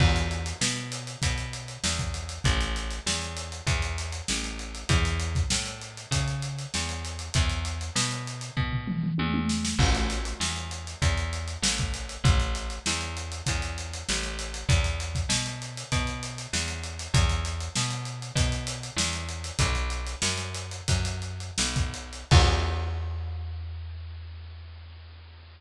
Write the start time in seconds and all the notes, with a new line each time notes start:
0.00 E2, kick, crash
0.16 closed hi-hat
0.31 closed hi-hat
0.46 closed hi-hat
0.61 B2, snare
0.76 closed hi-hat
0.92 closed hi-hat
1.07 closed hi-hat
1.22 B2, kick, closed hi-hat
1.38 closed hi-hat
1.53 closed hi-hat
1.68 closed hi-hat
1.84 E2, snare
1.99 kick, closed hi-hat
2.14 closed hi-hat
2.29 closed hi-hat
2.44 A1, kick, closed hi-hat
2.61 closed hi-hat
2.76 closed hi-hat
2.91 closed hi-hat
3.06 E2, snare
3.22 closed hi-hat
3.37 closed hi-hat
3.52 closed hi-hat
3.67 E2, kick, closed hi-hat
3.82 closed hi-hat
3.98 closed hi-hat
4.12 closed hi-hat
4.28 A1, snare
4.44 closed hi-hat
4.59 closed hi-hat
4.75 closed hi-hat
4.89 E2, kick, closed hi-hat
5.05 closed hi-hat
5.20 closed hi-hat
5.35 kick, closed hi-hat
5.50 A2, snare
5.66 closed hi-hat
5.82 closed hi-hat
5.97 closed hi-hat
6.11 C#3, kick, closed hi-hat
6.28 closed hi-hat
6.42 closed hi-hat
6.59 closed hi-hat
6.74 E2, snare
6.89 closed hi-hat
7.05 closed hi-hat
7.19 closed hi-hat
7.34 E2, kick, closed hi-hat
7.49 closed hi-hat
7.65 closed hi-hat
7.81 closed hi-hat
7.95 B2, snare
8.11 closed hi-hat
8.27 closed hi-hat
8.41 closed hi-hat
8.57 B2, kick, floor tom
8.72 floor tom
8.88 mid tom
9.03 mid tom
9.18 E2, high tom
9.34 high tom
9.49 snare
9.65 snare
9.79 A1, kick, crash
9.95 closed hi-hat
10.10 closed hi-hat
10.25 closed hi-hat
10.40 E2, snare
10.56 closed hi-hat
10.71 closed hi-hat
10.87 closed hi-hat
11.02 E2, kick, closed hi-hat
11.17 closed hi-hat
11.33 closed hi-hat
11.48 closed hi-hat
11.62 A1, snare
11.78 kick, closed hi-hat
11.94 closed hi-hat
12.09 closed hi-hat
12.24 A1, kick, closed hi-hat
12.40 closed hi-hat
12.55 closed hi-hat
12.70 closed hi-hat
12.86 E2, snare
13.01 closed hi-hat
13.17 closed hi-hat
13.32 closed hi-hat
13.46 E2, kick, closed hi-hat
13.62 closed hi-hat
13.78 closed hi-hat
13.93 closed hi-hat
14.09 A1, snare
14.23 closed hi-hat
14.39 closed hi-hat
14.54 closed hi-hat
14.69 E2, kick, closed hi-hat
14.84 closed hi-hat
15.00 closed hi-hat
15.15 kick, closed hi-hat
15.29 B2, snare
15.46 closed hi-hat
15.62 closed hi-hat
15.77 closed hi-hat
15.92 B2, kick, closed hi-hat
16.07 closed hi-hat
16.23 closed hi-hat
16.38 closed hi-hat
16.53 E2, snare
16.68 closed hi-hat
16.84 closed hi-hat
16.99 closed hi-hat
17.14 E2, kick, closed hi-hat
17.29 closed hi-hat
17.45 closed hi-hat
17.60 closed hi-hat
17.76 B2, snare
17.90 closed hi-hat
18.05 closed hi-hat
18.22 closed hi-hat
18.35 B2, kick, closed hi-hat
18.52 closed hi-hat
18.67 closed hi-hat
18.83 closed hi-hat
18.96 E2, snare
19.13 closed hi-hat
19.29 closed hi-hat
19.44 closed hi-hat
19.59 B1, kick, closed hi-hat
19.75 closed hi-hat
19.90 closed hi-hat
20.07 closed hi-hat
20.22 F#2, snare
20.37 closed hi-hat
20.55 closed hi-hat
20.71 closed hi-hat
20.88 F#2, kick, closed hi-hat
21.05 closed hi-hat
21.22 closed hi-hat
21.40 closed hi-hat
21.58 B1, snare
21.76 kick, closed hi-hat
21.94 closed hi-hat
22.13 closed hi-hat
22.31 E2, kick, crash